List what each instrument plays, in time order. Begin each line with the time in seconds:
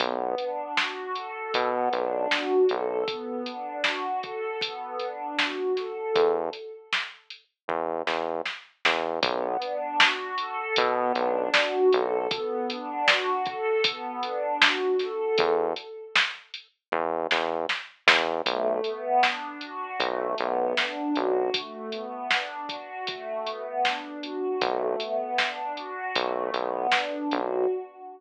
0.00 synth bass 1 B1, pad 2 (warm) B3, kick, closed hi-hat
0.38 pad 2 (warm) D4, closed hi-hat
0.76 pad 2 (warm) F#4, snare
1.15 pad 2 (warm) A4, closed hi-hat
1.54 synth bass 1 B2, pad 2 (warm) B3, kick, closed hi-hat
1.92 synth bass 1 B1, pad 2 (warm) D4, closed hi-hat
2.30 pad 2 (warm) F#4, snare
2.69 synth bass 1 B1, pad 2 (warm) A4, closed hi-hat
3.08 pad 2 (warm) B3, kick, closed hi-hat
3.46 pad 2 (warm) D4, closed hi-hat
3.84 pad 2 (warm) F#4, snare
4.23 pad 2 (warm) A4, kick, closed hi-hat
4.61 pad 2 (warm) B3, kick, closed hi-hat
5.00 pad 2 (warm) D4, closed hi-hat
5.39 pad 2 (warm) F#4, snare
5.76 pad 2 (warm) A4, snare, closed hi-hat
6.15 synth bass 1 E2, kick, closed hi-hat
6.53 closed hi-hat
6.93 snare
7.30 closed hi-hat
7.68 synth bass 1 E2, kick
8.07 synth bass 1 E2, snare
8.46 snare
8.85 synth bass 1 E2, snare
9.22 synth bass 1 B1, pad 2 (warm) B3, kick, closed hi-hat
9.62 pad 2 (warm) D4, closed hi-hat
10.00 pad 2 (warm) F#4, snare
10.38 pad 2 (warm) A4, closed hi-hat
10.76 synth bass 1 B2, pad 2 (warm) B3, kick, closed hi-hat
11.15 synth bass 1 B1, pad 2 (warm) D4, closed hi-hat
11.54 pad 2 (warm) F#4, snare
11.92 synth bass 1 B1, pad 2 (warm) A4, closed hi-hat
12.31 pad 2 (warm) B3, kick, closed hi-hat
12.70 pad 2 (warm) D4, closed hi-hat
13.07 pad 2 (warm) F#4, snare
13.46 pad 2 (warm) A4, kick, closed hi-hat
13.84 pad 2 (warm) B3, kick, closed hi-hat
14.23 pad 2 (warm) D4, closed hi-hat
14.61 pad 2 (warm) F#4, snare
14.99 pad 2 (warm) A4, snare, closed hi-hat
15.38 synth bass 1 E2, kick, closed hi-hat
15.76 closed hi-hat
16.16 snare
16.54 closed hi-hat
16.92 synth bass 1 E2, kick
17.31 synth bass 1 E2, snare
17.69 snare
18.07 synth bass 1 E2, snare
18.46 synth bass 1 B1, pad 2 (warm) A3, kick, closed hi-hat
18.84 pad 2 (warm) B3, closed hi-hat
19.22 pad 2 (warm) D4, snare
19.61 pad 2 (warm) F#4, closed hi-hat
20.00 synth bass 1 B1, pad 2 (warm) A3, kick, closed hi-hat
20.38 synth bass 1 B1, pad 2 (warm) B3, closed hi-hat
20.77 pad 2 (warm) D4, snare
21.16 synth bass 1 B1, pad 2 (warm) F#4, closed hi-hat
21.54 pad 2 (warm) A3, kick, closed hi-hat
21.92 pad 2 (warm) B3, closed hi-hat
22.31 pad 2 (warm) D4, snare
22.69 pad 2 (warm) F#4, kick, closed hi-hat
23.07 pad 2 (warm) A3, kick, closed hi-hat
23.46 pad 2 (warm) B3, closed hi-hat
23.84 pad 2 (warm) D4, snare
24.23 pad 2 (warm) F#4, closed hi-hat
24.61 synth bass 1 B1, pad 2 (warm) A3, kick, closed hi-hat
25.00 pad 2 (warm) B3, closed hi-hat
25.38 pad 2 (warm) D4, snare
25.77 pad 2 (warm) F#4, closed hi-hat
26.16 synth bass 1 B1, pad 2 (warm) A3, kick, closed hi-hat
26.53 synth bass 1 B1, pad 2 (warm) B3, closed hi-hat
26.92 pad 2 (warm) D4, snare
27.31 synth bass 1 B1, pad 2 (warm) F#4, closed hi-hat